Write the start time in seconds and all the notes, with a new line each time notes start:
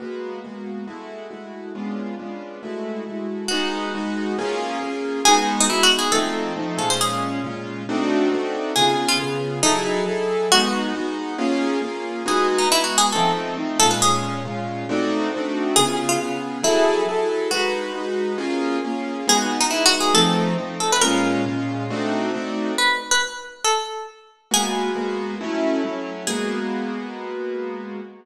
0.00 G#3 A#3 B3 F#4
0.44 G#3 A#3 B3 F#4
0.87 G#3 A3 E4 F#4
1.31 G#3 A3 E4 F#4
1.75 G#3 B3 C#4 D4 F4
2.19 G#3 B3 C#4 D4 F4
2.63 G#3 A3 E4 F#4
3.07 G#3 A3 E4 F#4
3.48 G#3 B3 D#4 F#4
3.95 G#3 B3 D#4 F#4
4.38 A#3 C#4 F4 G#4
4.81 A#3 C#4 F4 G#4
5.25 G#3 B3 D#4 F#4 G#4
5.60 D#4
5.69 G#3 B3 D#4 E4 F#4
5.83 F#4
5.99 G#4
6.12 F3 A3 C4 D#4 A4
6.56 F3 A3 C4 D#4
6.78 A#2 G#3 C#4 F4 A4
6.90 C5
7.01 G#4
7.44 A#2 G#3 C#4 F4
7.89 A3 C4 D4 D#4 F#4
8.32 A3 C4 D4 D#4 F#4
8.76 C#3 B3 F4 G#4
9.08 F4
9.20 C#3 B3 F4 G#4
9.63 F#3 D#4 E4 G#4 A4
10.06 F#3 E4 G#4 A4
10.52 G#3 B3 D#4 F#4
10.95 G#3 B3 D#4 F#4
11.38 A#3 C#4 F4 G#4
11.82 A#3 C#4 F4 G#4
12.26 G#3 B3 D#4 F#4 G#4
12.58 D#4
12.71 G#3 B3 D#4 E4 F#4
12.84 F#4
12.98 G#4
13.12 F3 A3 C4 D#4 A4
13.57 F3 A3 C4 D#4
13.79 A#2 G#3 C#4 F4 A4
13.91 B4
14.02 G#4
14.45 A#2 G#3 C#4 F4
14.89 A3 C4 D4 D#4 F#4
15.34 A3 C4 D4 D#4 F#4
15.76 C#3 B3 F4 G#4
16.09 F4
16.20 C#3 B3 F4 G#4
16.63 F#3 E4 G#4 A4
17.09 F#3 E4 G#4 A4
17.51 G#3 D#4 F#4 B4
17.95 G#3 D#4 F#4 B4
18.38 A#3 C#4 F4 G#4
18.84 A#3 C#4 F4 G#4
19.27 G#3 B3 D#4 F#4 G#4
19.61 D#4
19.71 G#3 B3 D#4 E4 F#4
19.86 F#4
20.00 G#4
20.14 F3 A3 C4 D#4 A4
20.58 F3 A3 C4 D#4
20.80 A4
20.92 B4
21.01 A#2 G#3 C#4 F4 A#4
21.46 A#2 G#3 C#4 F4
21.90 A3 C4 D4 D#4 F#4
22.34 A3 C4 D4 D#4 F#4
22.78 B4
23.11 B4
23.65 A4
24.51 G#3 A#3 B3 F#4 G#4
24.95 G#3 A#3 B3 F#4
25.41 F#3 A3 C#4 E4
25.84 F#3 A3 C#4 E4
26.27 G#3 A#3 B3 F#4 G#4